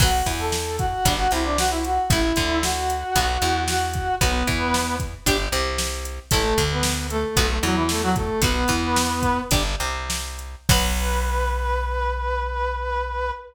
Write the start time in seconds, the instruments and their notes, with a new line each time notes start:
0.00 electric bass (finger) B1, acoustic guitar (steel) F#3 B3, brass section F#4 F#5, kick, crash
0.26 electric bass (finger) E2, acoustic guitar (steel) E3, kick, closed hi-hat
0.39 brass section A4 A5
0.52 snare
0.79 brass section F#4 F#5, kick, closed hi-hat
1.05 electric bass (finger) G1, acoustic guitar (steel) G3 D4, kick, closed hi-hat
1.19 brass section F#4 F#5
1.31 electric bass (finger) C2, acoustic guitar (steel) C3, brass section E4 E5, closed hi-hat
1.45 brass section D4 D5
1.58 brass section F#4 F#5, snare
1.71 brass section E4 E5
1.84 brass section F#4 F#5, closed hi-hat
2.10 electric bass (finger) A1, acoustic guitar (steel) A3 E4, brass section E4 E5, kick, closed hi-hat
2.36 electric bass (finger) D2, acoustic guitar (steel) D3, kick, closed hi-hat
2.63 brass section F#4 F#5, snare
2.90 closed hi-hat
3.15 electric bass (finger) B1, acoustic guitar (steel) B3 F#4, kick, closed hi-hat
3.42 electric bass (finger) E2, acoustic guitar (steel) E3, closed hi-hat
3.68 brass section F#4 F#5, snare
3.94 kick, closed hi-hat
4.21 electric bass (finger) B1, acoustic guitar (steel) B3 F#4, brass section B3 B4, kick, closed hi-hat
4.47 electric bass (finger) E2, acoustic guitar (steel) E3, kick, closed hi-hat
4.74 snare
5.00 kick, closed hi-hat
5.26 electric bass (finger) G1, acoustic guitar (steel) D4 G4, kick, closed hi-hat
5.52 electric bass (finger) C2, acoustic guitar (steel) C3, closed hi-hat
5.78 snare
6.05 closed hi-hat
6.31 electric bass (finger) A1, acoustic guitar (steel) A3 E4, brass section A3 A4, kick, closed hi-hat
6.58 electric bass (finger) D2, acoustic guitar (steel) D3, kick, closed hi-hat
6.71 brass section B3 B4
6.83 snare
7.10 brass section A3 A4, closed hi-hat
7.36 electric bass (finger) B1, acoustic guitar (steel) B3 F#4, kick, closed hi-hat
7.50 brass section A3 A4
7.63 electric bass (finger) E2, acoustic guitar (steel) E3, brass section F#3 F#4, closed hi-hat
7.76 brass section E3 E4
7.89 brass section A3 A4, snare
8.03 brass section F#3 F#4
8.16 brass section A3 A4, kick, closed hi-hat
8.42 electric bass (finger) B1, acoustic guitar (steel) B3 F#4, brass section B3 B4, kick, closed hi-hat
8.68 electric bass (finger) E2, acoustic guitar (steel) E3, kick, closed hi-hat
8.96 snare
9.22 kick, closed hi-hat
9.51 electric bass (finger) G1, acoustic guitar (steel) D4 G4, kick, closed hi-hat
9.80 electric bass (finger) C2, acoustic guitar (steel) C3, closed hi-hat
10.10 snare
10.39 closed hi-hat
10.69 electric bass (finger) B1, acoustic guitar (steel) F#3 B3, brass section B4, kick, crash